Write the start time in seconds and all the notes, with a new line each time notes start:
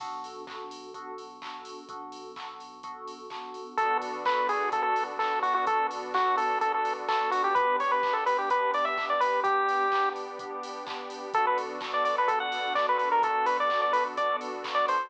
0.00 B1 B3 D4 F#4 A4, kick, crash
0.24 open hi-hat
0.47 B3 D4 F#4 A4, kick, clap
0.71 open hi-hat
0.94 B3 D4 F#4 A4, kick, closed hi-hat
1.18 open hi-hat
1.42 B3 D4 F#4 A4, kick, clap
1.65 open hi-hat
1.89 B1 B3 D4 F#4 A4, kick, closed hi-hat
2.12 open hi-hat
2.36 B3 D4 F#4 A4, kick, clap
2.60 open hi-hat
2.83 B3 D4 F#4 A4, kick, closed hi-hat
3.08 open hi-hat
3.30 B3 D4 F#4 A4, kick, clap
3.54 open hi-hat
3.77 B1 B3 D4 F#4 A4, kick, closed hi-hat
4.02 open hi-hat
4.25 B3 D4 F#4 A4 B4, kick, clap
4.49 G#4, open hi-hat
4.72 B3 D4 F#4 A4, kick, closed hi-hat
4.83 A4
4.96 open hi-hat
5.19 B3 D4 F#4 A4, kick, clap
5.42 F#4, open hi-hat
5.54 F#4
5.66 B1 B3 D4 F#4 A4, kick, closed hi-hat
5.91 open hi-hat
6.14 B3 D4 F#4 A4, kick, clap
6.37 A4, open hi-hat
6.61 B3 D4 F#4 A4, kick, closed hi-hat
6.74 A4
6.85 open hi-hat
7.08 B3 D4 F#4 A4, kick, clap
7.31 F#4, open hi-hat
7.44 G4
7.54 G1 B3 D4 G4 B4, kick, closed hi-hat
7.80 C#5, open hi-hat
7.91 B4
8.03 B3 D4 G4, kick, clap
8.13 A4
8.26 B4, open hi-hat
8.38 G4
8.50 B3 D4 G4 B4, kick, closed hi-hat
8.74 D5, open hi-hat
8.85 E5
8.98 B3 D4 G4, kick, clap
9.10 D5
9.20 B4, open hi-hat
9.44 G1 B3 D4 G4, kick, closed hi-hat
9.69 open hi-hat
9.92 B3 D4 G4, kick, clap
10.16 open hi-hat
10.39 B3 D4 G4, kick, closed hi-hat
10.63 open hi-hat
10.87 B3 D4 G4, kick, clap
11.10 open hi-hat
11.33 B1 B3 D4 F#4 A4, kick, closed hi-hat
11.47 B4
11.58 open hi-hat
11.81 B3 D4 F#4 A4, kick, clap
11.94 D5
12.05 D5, open hi-hat
12.18 B4
12.28 B3 D4 F#4 A4, kick, closed hi-hat
12.40 F#5
12.52 open hi-hat
12.75 B3 D4 F#4 A4 D5, kick, clap
12.89 B4
12.98 B4, open hi-hat
13.12 A#4
13.22 B1 B3 D4 F#4 A4, kick, closed hi-hat
13.46 B4, open hi-hat
13.60 D5
13.70 B3 D4 F#4 A4, kick, clap
13.82 D5
13.93 B4, open hi-hat
14.17 B3 D4 F#4 A4 D5, kick, closed hi-hat
14.41 open hi-hat
14.64 B3 D4 F#4 A4, kick, clap
14.75 D5
14.88 C5, open hi-hat